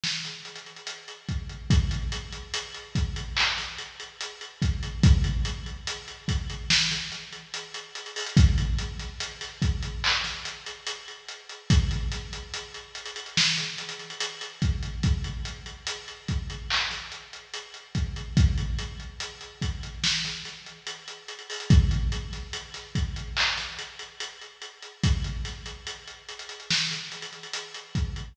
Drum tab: HH |--x-xxxxx-x-x-x-|x-x-x-x-x-x-x-x---x-x-x-x-x-x-x-|x-x-x-x-x-x-x-x---x-x-x-x-x-xxox|x-x-x-x-x-x-x-x---x-x-x-x-x-x-x-|
CP |----------------|----------------x---------------|--------------------------------|----------------x---------------|
SD |o-o-------------|------------------o-------------|----------------o-o-o-----------|------o---o-------o-------------|
BD |------------o---|o-----------o---------------o---|o-----------o-------------------|o-----------o-------------------|

HH |x-x-x-x-x-x-xxxx--x-xxxxx-x-x-x-|x-x-x-x-x-x-x-x---x-x-x-x-x-x-x-|x-x-x-x-x-x-x-x---x-x-x-x-x-xxox|x-x-x-x-x-x-x-x---x-x-x-x-x-x-x-|
CP |--------------------------------|----------------x---------------|--------------------------------|----------------x---------------|
SD |----o-----------o-o-------------|------------------o-------------|----------------o-o-o-----------|------o---o-------o-------------|
BD |o---------------------------o---|o-----------o---------------o---|o-----------o-------------------|o-----------o-------------------|

HH |x-x-x-x-x-x-xxxx--x-xxxxx-x-x-x-|
CP |--------------------------------|
SD |----o-----------o-o-------------|
BD |o---------------------------o---|